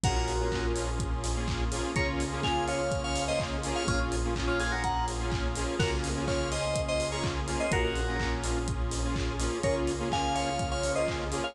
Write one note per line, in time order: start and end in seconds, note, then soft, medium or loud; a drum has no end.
0.04 1.80 A#1 loud
0.04 1.94 A#3 medium
0.04 0.33 A#3 medium
0.04 1.94 C#4 medium
0.04 0.33 C#4 loud
0.04 1.94 F4 medium
0.04 0.33 F4 medium
0.04 0.15 F#4 medium
0.04 1.94 G#4 medium
0.04 0.33 G#4 medium
0.04 0.15 A#4 loud
0.04 kick loud
0.04 closed hi-hat loud
0.16 0.66 F#4 medium
0.16 0.66 A#4 medium
0.28 open hi-hat medium
0.39 0.49 A#3 medium
0.39 0.49 C#4 medium
0.39 0.49 F4 medium
0.39 0.49 G#4 medium
0.52 0.90 A#3 medium
0.52 0.90 C#4 medium
0.52 0.90 F4 medium
0.52 0.90 G#4 medium
0.52 kick medium
0.52 clap loud
0.76 open hi-hat medium
0.99 kick medium
0.99 closed hi-hat medium
1.24 snare medium
1.24 open hi-hat medium
1.36 1.64 A#3 medium
1.36 1.64 C#4 medium
1.36 1.64 F4 medium
1.36 1.64 G#4 medium
1.48 kick medium
1.48 clap medium
1.72 1.92 A#3 medium
1.72 1.92 C#4 medium
1.72 1.92 F4 medium
1.72 1.92 G#4 medium
1.72 open hi-hat medium
1.96 3.72 C#2 medium
1.96 3.86 A#3 medium
1.96 2.25 A#3 loud
1.96 3.86 C#4 medium
1.96 2.25 C#4 loud
1.96 3.86 F4 medium
1.96 2.25 F4 loud
1.96 3.86 G#4 medium
1.96 2.25 G#4 loud
1.96 2.07 A#4 medium
1.96 2.07 C#5 medium
1.96 kick medium
1.96 closed hi-hat medium
2.20 open hi-hat medium
2.31 2.41 A#3 loud
2.31 2.41 C#4 medium
2.31 2.41 F4 medium
2.31 2.41 G#4 medium
2.43 2.81 A#3 medium
2.43 2.81 C#4 medium
2.43 2.81 F4 medium
2.43 2.81 G#4 medium
2.43 2.65 F5 medium
2.43 2.65 G#5 medium
2.43 kick medium
2.43 clap medium
2.68 3.01 C#5 medium
2.68 3.01 F5 medium
2.68 open hi-hat medium
2.91 kick medium
2.91 closed hi-hat medium
3.04 3.24 C#5 medium
3.04 3.24 F5 medium
3.16 snare soft
3.16 open hi-hat medium
3.28 3.57 A#3 medium
3.28 3.57 C#4 medium
3.28 3.57 F4 medium
3.28 3.57 G#4 medium
3.28 3.39 C5 medium
3.28 3.39 D#5 medium
3.40 kick medium
3.40 clap medium
3.64 3.83 A#3 medium
3.64 3.83 C#4 medium
3.64 3.83 F4 medium
3.64 3.83 G#4 loud
3.64 open hi-hat medium
3.75 3.87 C#5 medium
3.75 3.87 F5 medium
3.88 5.64 A#1 loud
3.88 4.16 A#3 medium
3.88 5.78 A#3 medium
3.88 4.16 C#4 medium
3.88 5.78 C#4 medium
3.88 3.99 C#4 medium
3.88 4.16 F4 loud
3.88 5.78 F4 medium
3.88 3.99 F4 loud
3.88 4.16 G#4 medium
3.88 5.78 G#4 medium
3.88 kick medium
3.88 closed hi-hat medium
4.12 open hi-hat medium
4.25 4.34 A#3 medium
4.25 4.34 C#4 medium
4.25 4.34 F4 medium
4.25 4.34 G#4 medium
4.36 4.74 A#3 medium
4.36 4.74 C#4 medium
4.36 4.74 F4 loud
4.36 4.74 G#4 medium
4.36 kick medium
4.36 clap loud
4.47 4.59 C#4 medium
4.47 4.59 F4 medium
4.60 4.71 F4 medium
4.60 4.71 G#4 loud
4.60 open hi-hat medium
4.72 4.83 F#4 medium
4.72 4.83 A#4 medium
4.84 5.05 F#5 medium
4.84 5.05 A#5 medium
4.84 kick medium
4.84 closed hi-hat medium
5.08 snare medium
5.08 open hi-hat medium
5.19 5.48 A#3 medium
5.19 5.48 C#4 medium
5.19 5.48 F4 medium
5.19 5.48 G#4 medium
5.32 kick medium
5.32 clap medium
5.55 5.75 A#3 medium
5.55 5.75 C#4 medium
5.55 5.75 F4 medium
5.55 5.75 G#4 medium
5.55 open hi-hat medium
5.79 7.56 C#2 loud
5.79 7.70 A#3 medium
5.79 6.09 A#3 loud
5.79 7.70 C#4 medium
5.79 6.09 C#4 loud
5.79 7.70 F4 medium
5.79 6.09 F4 loud
5.79 5.91 F#4 medium
5.79 7.70 G#4 medium
5.79 6.09 G#4 medium
5.79 5.91 A#4 loud
5.79 kick loud
5.79 crash medium
6.04 open hi-hat medium
6.16 6.25 A#3 medium
6.16 6.25 C#4 medium
6.16 6.25 F4 medium
6.16 6.25 G#4 medium
6.27 6.66 A#3 medium
6.27 6.66 C#4 medium
6.27 6.66 F4 medium
6.27 6.66 G#4 medium
6.27 6.49 C#5 medium
6.27 6.49 F5 medium
6.27 kick medium
6.27 clap medium
6.52 6.81 C5 medium
6.52 6.81 D#5 medium
6.52 open hi-hat medium
6.76 kick medium
6.76 closed hi-hat loud
6.88 7.08 C5 medium
6.88 7.08 D#5 medium
7.00 snare medium
7.00 open hi-hat medium
7.12 7.41 A#3 medium
7.12 7.41 C#4 medium
7.12 7.41 F4 medium
7.12 7.41 G#4 medium
7.12 7.23 A#4 medium
7.12 7.23 C#5 medium
7.24 kick medium
7.24 clap medium
7.48 7.67 A#3 medium
7.48 7.67 C#4 medium
7.48 7.67 F4 medium
7.48 7.67 G#4 medium
7.48 open hi-hat medium
7.60 7.71 C5 medium
7.60 7.71 D#5 medium
7.72 9.48 A#1 loud
7.72 9.62 A#3 medium
7.72 8.01 A#3 medium
7.72 9.62 C#4 medium
7.72 8.01 C#4 loud
7.72 9.62 F4 medium
7.72 8.01 F4 medium
7.72 7.84 F#4 medium
7.72 9.62 G#4 medium
7.72 8.01 G#4 medium
7.72 7.84 A#4 loud
7.72 kick loud
7.72 closed hi-hat loud
7.84 8.34 F#4 medium
7.84 8.34 A#4 medium
7.96 open hi-hat medium
8.07 8.17 A#3 medium
8.07 8.17 C#4 medium
8.07 8.17 F4 medium
8.07 8.17 G#4 medium
8.20 8.59 A#3 medium
8.20 8.59 C#4 medium
8.20 8.59 F4 medium
8.20 8.59 G#4 medium
8.20 kick medium
8.20 clap loud
8.44 open hi-hat medium
8.68 kick medium
8.68 closed hi-hat medium
8.91 snare medium
8.91 open hi-hat medium
9.04 9.33 A#3 medium
9.04 9.33 C#4 medium
9.04 9.33 F4 medium
9.04 9.33 G#4 medium
9.16 kick medium
9.16 clap medium
9.39 9.59 A#3 medium
9.39 9.59 C#4 medium
9.39 9.59 F4 medium
9.39 9.59 G#4 medium
9.39 open hi-hat medium
9.63 11.40 C#2 medium
9.63 9.93 A#3 loud
9.63 11.54 A#3 medium
9.63 9.93 C#4 loud
9.63 11.54 C#4 medium
9.63 9.93 F4 loud
9.63 11.54 F4 medium
9.63 9.93 G#4 loud
9.63 11.54 G#4 medium
9.63 9.75 A#4 medium
9.63 9.75 C#5 medium
9.63 kick medium
9.63 closed hi-hat medium
9.87 open hi-hat medium
9.99 10.09 A#3 loud
9.99 10.09 C#4 medium
9.99 10.09 F4 medium
9.99 10.09 G#4 medium
10.11 10.50 A#3 medium
10.11 10.50 C#4 medium
10.11 10.50 F4 medium
10.11 10.50 G#4 medium
10.11 10.34 F5 medium
10.11 10.34 G#5 medium
10.11 kick medium
10.11 clap medium
10.35 10.68 C#5 medium
10.35 10.68 F5 medium
10.35 open hi-hat medium
10.59 kick medium
10.59 closed hi-hat medium
10.71 10.91 C#5 medium
10.71 10.91 F5 medium
10.84 snare soft
10.84 open hi-hat medium
10.95 11.25 A#3 medium
10.95 11.25 C#4 medium
10.95 11.25 F4 medium
10.95 11.25 G#4 medium
10.95 11.07 C5 medium
10.95 11.07 D#5 medium
11.08 kick medium
11.08 clap medium
11.31 11.51 A#3 medium
11.31 11.51 C#4 medium
11.31 11.51 F4 medium
11.31 11.51 G#4 loud
11.31 open hi-hat medium
11.44 11.55 C#5 medium
11.44 11.55 F5 medium